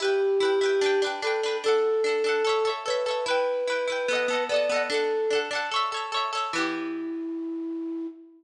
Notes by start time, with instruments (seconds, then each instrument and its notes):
0.00 pizzicato strings E4 B4, flute G4
0.05 pizzicato strings G5
0.40 pizzicato strings E4 B4
0.45 pizzicato strings G5
0.61 pizzicato strings E4 B4
0.66 pizzicato strings G5
0.81 pizzicato strings D4 B4
0.86 pizzicato strings G5
1.02 pizzicato strings D4 B4
1.07 pizzicato strings G5
1.22 pizzicato strings D4 B4, flute A4
1.27 pizzicato strings G5
1.43 pizzicato strings D4 B4
1.48 pizzicato strings G5
1.64 pizzicato strings D4 A4, flute A4
1.68 pizzicato strings F#5
2.04 pizzicato strings D4 A4
2.09 pizzicato strings F#5
2.24 pizzicato strings D4 A4
2.29 pizzicato strings F#5
2.45 pizzicato strings A4 C#5
2.49 pizzicato strings E5
2.65 pizzicato strings A4 C#5
2.69 pizzicato strings E5
2.86 pizzicato strings A4 C#5, flute B4
2.90 pizzicato strings E5
3.06 pizzicato strings A4 C#5
3.11 pizzicato strings E5
3.26 pizzicato strings E4 B4, flute B4
3.31 pizzicato strings G5
3.68 pizzicato strings E4 B4
3.72 pizzicato strings G5
3.87 pizzicato strings E4 B4
3.92 pizzicato strings G5
4.08 pizzicato strings B3 A4
4.13 pizzicato strings D#5 F#5
4.28 pizzicato strings B3 A4
4.33 pizzicato strings D#5 F#5
4.49 pizzicato strings B3 A4, flute D5
4.54 pizzicato strings D#5 F#5
4.69 pizzicato strings B3 A4
4.74 pizzicato strings D#5 F#5
4.90 pizzicato strings D4 A4, flute A4
4.94 pizzicato strings F#5
5.30 pizzicato strings D4 A4
5.35 pizzicato strings F#5
5.51 pizzicato strings D4 A4
5.55 pizzicato strings F#5
5.71 pizzicato strings A4 C#5
5.76 pizzicato strings E5
5.92 pizzicato strings A4 C#5
5.97 pizzicato strings E5
6.12 pizzicato strings A4 C#5
6.17 pizzicato strings E5
6.33 pizzicato strings A4 C#5
6.37 pizzicato strings E5
6.53 pizzicato strings E3 B3, flute E4
6.58 pizzicato strings G4